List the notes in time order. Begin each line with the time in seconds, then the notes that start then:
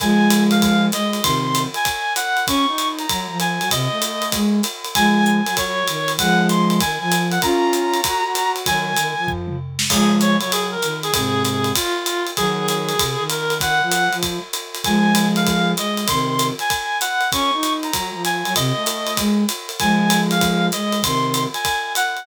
0.00 F3 G#3 G#5, kick, ride
0.30 hi-hat pedal, ride
0.51 F5, ride
0.62 kick, ride
0.92 G#3 D#5, hi-hat pedal, ride
1.13 ride
1.23 C3 D#3 C6, kick, ride
1.55 hi-hat pedal, ride
1.74 G#5, ride
1.85 kick, ride
2.16 F#5, hi-hat pedal, ride
2.37 ride
2.47 C#4 C#6, kick, ride
2.68 D#4
2.78 hi-hat pedal, ride
2.99 A#5, ride
3.09 F#3, kick, ride
3.29 F3
3.40 G#5, hi-hat pedal, ride
3.61 F#3, ride
3.70 C3 D#5, kick, ride
3.91 A3
4.02 hi-hat pedal, ride
4.22 ride
4.32 G#3, kick, ride
4.63 hi-hat pedal, ride
4.84 ride
4.95 F3 G#3 G#5, kick, ride
5.26 G#5, hi-hat pedal
5.46 F#3, ride
5.57 C#5, kick, ride
5.87 D#3, hi-hat pedal, ride
6.08 ride
6.18 F3 G#3 F#5, kick, ride
6.49 C6, hi-hat pedal, ride
6.69 C6, ride
6.80 D#3 G#5, kick, ride
7.01 F3 G#5
7.11 hi-hat pedal, ride
7.31 F#5, ride
7.42 C#4 F4 A#5, kick, ride
7.73 hi-hat pedal, ride
7.94 ride
8.04 F#4, kick, ride
8.25 F#4
8.35 hi-hat pedal, ride
8.56 ride
8.66 D#3 F#3 G#5, kick, ride
8.97 D#3, hi-hat pedal, ride
9.17 F3
9.28 kick, floor tom
9.48 mid tom
9.79 snare
9.89 F3 G#3 G#4, kick, crash, ride
10.20 C#5, hi-hat pedal, ride
10.41 F#3 C#5, ride
10.52 G#4, ride
10.71 A#4
10.82 D#3, hi-hat pedal, ride
11.03 G#4, ride
11.13 G#2 C3 G#4, kick, ride
11.44 G#4, hi-hat pedal, ride
11.64 ride
11.75 F4, kick, ride
12.06 hi-hat pedal, ride
12.27 ride
12.37 D#3 F#3 G#4, kick, ride
12.68 G#4, hi-hat pedal, ride
12.89 ride
12.99 C3, kick, ride
13.19 D#3
13.30 A#4, hi-hat pedal, ride
13.50 ride
13.60 D#3 F#5, kick, ride
13.81 F3
13.91 hi-hat pedal, ride
14.12 F3, ride
14.23 kick, ride
14.53 hi-hat pedal, ride
14.75 ride
14.84 F3 G#3 G#5, kick, ride
15.15 hi-hat pedal, ride
15.36 F5, ride
15.47 kick, ride
15.77 G#3 D#5, hi-hat pedal, ride
15.97 ride
16.08 C3 D#3 C6, kick, ride
16.39 hi-hat pedal, ride
16.59 G#5, ride
16.70 kick, ride
17.01 F#5, hi-hat pedal, ride
17.21 ride
17.32 C#4 C#6, kick, ride
17.53 D#4
17.63 hi-hat pedal, ride
17.83 A#5, ride
17.93 F#3, kick, ride
18.14 F3
18.25 G#5, hi-hat pedal, ride
18.45 F#3, ride
18.55 C3 D#5, kick, ride
18.76 A3
18.86 hi-hat pedal, ride
19.07 ride
19.17 G#3, kick, ride
19.49 hi-hat pedal, ride
19.69 ride
19.79 F3 G#3 G#5, kick, ride
20.10 hi-hat pedal, ride
20.31 F5, ride
20.41 kick, ride
20.72 G#3 D#5, hi-hat pedal, ride
20.92 ride
21.03 C3 D#3 C6, kick, ride
21.34 hi-hat pedal, ride
21.54 G#5, ride
21.65 kick, ride
21.95 F#5, hi-hat pedal, ride
22.17 ride